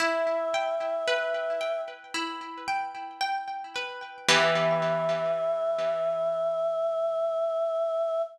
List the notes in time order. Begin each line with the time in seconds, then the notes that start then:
0.00 E4 E5
0.54 G5
1.08 B4
1.61 G5
2.14 E4
2.68 G5
3.21 G5
3.76 B4
4.29 E3 B3 G4 E5